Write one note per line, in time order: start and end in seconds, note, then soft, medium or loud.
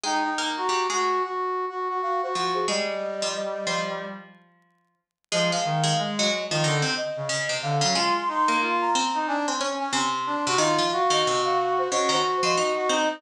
0.03 0.36 G#3 medium
0.03 0.23 D#4 medium
0.03 0.36 G#4 loud
0.03 0.35 G5 medium
0.24 0.49 D#4 medium
0.38 0.70 A#3 medium
0.38 0.70 A#4 loud
0.38 0.56 A#5 medium
0.57 0.87 F#4 medium
0.57 0.86 A#5 medium
0.69 0.88 G3 medium
0.69 0.88 G4 medium
0.90 1.20 G#3 medium
0.90 1.22 F#4 medium
0.90 1.20 G#4 medium
1.23 1.65 F#4 medium
1.69 1.88 F#4 medium
1.89 2.01 F#4 medium
2.02 2.21 F#4 medium
2.02 2.21 F5 medium
2.22 2.34 F#4 medium
2.22 2.54 C5 medium
2.35 2.67 F3 medium
2.35 2.67 F4 medium
2.35 2.65 F#4 medium
2.55 2.67 G#4 medium
2.68 4.06 G3 medium
2.68 2.87 G#3 loud
2.68 2.87 G#4 loud
2.68 3.28 D#5 medium
3.22 3.35 F3 medium
3.22 3.35 F4 loud
3.35 3.93 D#5 medium
3.67 4.95 F3 medium
3.67 4.95 F4 medium
5.32 5.51 F3 medium
5.32 5.51 G#3 loud
5.32 5.51 G#4 loud
5.32 5.51 D#5 medium
5.52 5.82 G#3 medium
5.52 5.82 G#4 medium
5.52 6.02 F5 medium
5.65 5.93 D#3 medium
5.84 6.09 G#3 loud
5.84 6.09 G#4 loud
5.98 6.29 G#3 medium
6.17 6.47 F#3 loud
6.17 6.47 F#4 loud
6.17 6.46 D#5 medium
6.50 6.63 D#3 medium
6.50 6.64 F3 medium
6.50 6.64 F4 loud
6.50 6.77 D#5 medium
6.63 6.82 D3 medium
6.63 6.83 D#3 loud
6.63 6.83 D#4 loud
6.82 6.95 C3 medium
6.82 6.95 C4 loud
6.97 7.60 D#5 medium
7.17 7.29 C#3 medium
7.29 7.48 C#3 medium
7.29 7.48 C#4 loud
7.49 7.76 C3 medium
7.49 7.76 C4 medium
7.63 7.81 D3 medium
7.63 7.94 F5 medium
7.81 7.94 C#3 medium
7.81 7.95 F#3 medium
7.81 7.94 C#4 loud
7.95 8.45 G#3 loud
7.95 8.14 F4 medium
7.95 8.45 G#4 loud
7.95 8.14 C6 medium
8.16 8.29 C6 medium
8.28 8.58 D#4 medium
8.28 8.61 C6 medium
8.48 8.88 A#3 medium
8.48 8.88 A#4 loud
8.61 8.90 F4 medium
8.81 9.19 A#5 medium
8.95 9.36 C4 loud
8.95 9.36 C5 loud
9.14 9.27 D#4 medium
9.27 9.46 D4 medium
9.27 9.46 G#5 medium
9.48 9.60 C4 medium
9.48 9.60 C5 loud
9.48 9.74 G#5 medium
9.61 9.89 C#4 loud
9.61 9.89 C#5 loud
9.80 9.92 C#4 medium
9.80 9.92 G#5 medium
9.93 10.36 C3 loud
9.93 10.36 C4 loud
9.93 10.52 C6 medium
10.26 10.45 D4 medium
10.46 10.59 C3 loud
10.46 10.59 C4 loud
10.46 10.59 F#4 medium
10.58 10.77 D#3 loud
10.58 10.77 D#4 loud
10.58 10.88 F4 medium
10.58 10.87 D#5 medium
10.78 10.91 F3 loud
10.78 10.91 F4 loud
10.92 11.88 F#4 medium
10.92 11.11 F5 medium
11.10 11.23 D#3 loud
11.10 11.23 D#4 loud
11.10 11.41 D#5 medium
11.27 11.88 C3 medium
11.27 11.88 C4 loud
11.45 11.73 F5 medium
11.78 11.91 C5 medium
11.91 12.11 C#3 medium
11.91 12.11 C#4 loud
11.91 12.10 F#4 medium
11.91 12.10 D#5 medium
12.09 12.21 D#3 loud
12.09 12.21 D#4 loud
12.09 12.72 F#4 medium
12.09 12.37 C5 medium
12.43 12.55 F3 loud
12.43 12.55 F4 loud
12.43 12.56 D#5 medium
12.57 12.89 D#4 medium
12.57 12.89 D#5 loud
12.57 13.20 D#5 medium
12.77 12.89 F#4 medium
12.89 13.21 C4 medium
12.89 13.09 D#4 medium
12.89 13.21 C5 loud